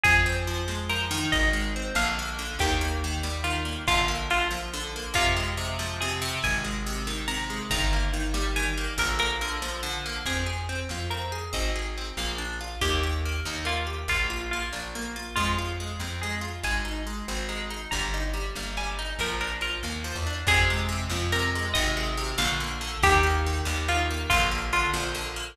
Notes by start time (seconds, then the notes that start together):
0.03 F2 F3 G#4, kick, closed hi-hat
0.26 C4
0.36 closed hi-hat
0.47 F3
0.68 G#3, snare
0.89 F3 A#4
1.00 closed hi-hat
1.11 D#3
1.32 G#1 D#5, kick, closed hi-hat
1.53 G#3
1.63 closed hi-hat
1.76 C4
1.95 A#1 D3 F5, snare
2.19 A#3
2.28 closed hi-hat
2.38 D3
2.59 D#2 D#3 G4, kick, closed hi-hat
2.81 A#3
3.04 D#3
3.23 G3, snare
3.44 D#3 F4
3.55 closed hi-hat
3.65 A#3
3.87 A#1 D3 F4, kick, closed hi-hat
4.08 A#3
4.19 closed hi-hat
4.30 D3 F4
4.50 F3, snare
4.73 D3
4.83 closed hi-hat
4.96 A#3
5.14 F2 C3 F4, kick, closed hi-hat
5.36 G#3
5.48 closed hi-hat
5.57 C3
5.79 F3, snare
6.00 C3 G#4
6.11 closed hi-hat
6.21 C3
6.42 G#1 G#5, kick, closed hi-hat
6.64 G#3
6.74 closed hi-hat
6.86 C3
7.07 D#3, snare
7.28 C3 A#5
7.39 open hi-hat
7.50 G#3
7.70 G1 D#3 A#5, kick, closed hi-hat
7.93 A#3
8.02 closed hi-hat
8.13 D#3
8.34 G3, snare
8.56 D#3 G#5
8.66 closed hi-hat
8.77 A#3
8.98 A#1 D3 A#4, kick, closed hi-hat
9.19 A#3 A#4
9.30 closed hi-hat
9.41 D3 A#4
9.62 F3, snare
9.83 D3
9.94 closed hi-hat
10.05 A#3
10.25 F2 C4 G#4, kick, crash
10.46 G#4
10.58 closed hi-hat
10.69 C4
10.89 F2 F4, snare
11.10 C4 A#4
11.21 closed hi-hat
11.32 G#4
11.53 G#1 C4 D#5, kick, closed hi-hat
11.75 G#4
11.86 closed hi-hat
11.97 C4
12.17 A#1 A#3 F5, snare
12.38 D4
12.49 open hi-hat
12.60 F4
12.81 D#2 A#3 G4, kick, closed hi-hat
13.03 G4
13.13 closed hi-hat
13.25 A#3
13.45 D#2 D#4, snare
13.65 A#3 F4
13.77 closed hi-hat
13.86 G4
14.08 A#1 A#3 F4, kick, closed hi-hat
14.30 F4
14.40 closed hi-hat
14.51 A#3 F4
14.73 A#1 D4, snare
14.95 A#3
15.05 closed hi-hat
15.16 F4
15.36 F2 G#3 F4, kick, closed hi-hat
15.58 F4
15.68 closed hi-hat
15.80 G#3
16.00 F2 C4, snare
16.21 G#3 G#4
16.32 closed hi-hat
16.41 F4
16.63 G#1 G#3 G#5, kick, closed hi-hat
16.85 D#4
16.96 closed hi-hat
17.06 G#3
17.28 G#1 C4, snare
17.48 G#3 A#5
17.60 closed hi-hat
17.70 D#4
17.91 G1 G3 A#5, kick, closed hi-hat
18.14 D#4
18.24 closed hi-hat
18.33 G3
18.55 G1 A#3, snare
18.77 G3 G#5
18.88 closed hi-hat
18.98 D#4
19.19 A#1 F3 A#4, kick, closed hi-hat
19.40 D4 A#4
19.52 closed hi-hat
19.61 F3 A#4
19.83 D#2 A#3, snare
20.04 F3
20.15 E2, open hi-hat
20.26 D4
20.47 F2 C3 G#4, kick, closed hi-hat
20.70 G#3
20.78 closed hi-hat
20.88 C3
21.09 F2 F3, snare
21.32 C3 A#4
21.44 closed hi-hat
21.55 G#3
21.74 G#1 C3 D#5, kick, closed hi-hat
21.97 G#3
22.07 closed hi-hat
22.17 C3
22.38 A#1 D3 F5, snare
22.60 A#3
22.71 closed hi-hat
22.81 D3
23.03 D#2 D#3 G4, kick, closed hi-hat
23.23 A#3
23.35 closed hi-hat
23.46 D#3
23.65 D#2 G3, snare
23.88 D#3 F4
23.99 closed hi-hat
24.10 A#3
24.30 A#1 D3 F4, kick, closed hi-hat
24.51 A#3
24.62 closed hi-hat
24.72 D3 F4
24.93 A#1 F3, snare
25.14 D3
25.26 closed hi-hat
25.36 A#3